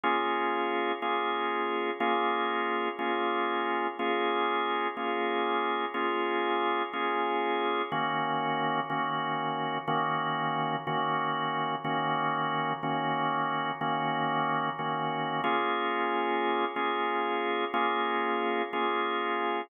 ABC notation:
X:1
M:12/8
L:1/8
Q:3/8=61
K:Bbm
V:1 name="Drawbar Organ"
[B,DFA]3 [B,DFA]3 [B,DFA]3 [B,DFA]3 | [B,DFA]3 [B,DFA]3 [B,DFA]3 [B,DFA]3 | [E,B,DG]3 [E,B,DG]3 [E,B,DG]3 [E,B,DG]3 | [E,B,DG]3 [E,B,DG]3 [E,B,DG]3 [E,B,DG]2 [B,DFA]- |
[B,DFA]3 [B,DFA]3 [B,DFA]3 [B,DFA]3 |]